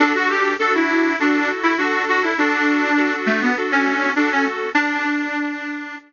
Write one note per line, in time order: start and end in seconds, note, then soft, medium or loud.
0.00 0.13 D4 loud
0.00 0.54 D4 loud
0.00 0.54 F#4 loud
0.00 0.54 A4 loud
0.15 0.29 F#4 loud
0.29 0.54 G4 medium
0.59 1.13 D4 loud
0.59 1.13 F#4 loud
0.59 0.73 A4 medium
0.75 1.16 E4 medium
1.19 1.49 D4 medium
1.19 1.73 F#4 loud
1.19 1.73 A4 medium
1.63 1.77 E4 medium
1.77 2.31 D4 loud
1.77 2.02 F#4 medium
1.77 2.31 A4 medium
2.09 2.23 F#4 medium
2.23 2.37 E4 medium
2.38 3.14 D4 loud
2.38 2.91 F#4 loud
2.38 2.91 A4 medium
2.97 3.50 D4 loud
2.97 3.50 F#4 loud
2.97 3.50 A4 loud
3.26 3.40 A3 loud
3.41 3.56 B3 medium
3.57 4.10 D4 medium
3.57 4.10 F#4 loud
3.57 4.10 A4 loud
3.72 4.12 C#4 medium
4.16 4.30 D4 medium
4.16 4.70 F#4 loud
4.16 4.70 A4 medium
4.31 4.45 C#4 loud
4.75 5.96 D4 loud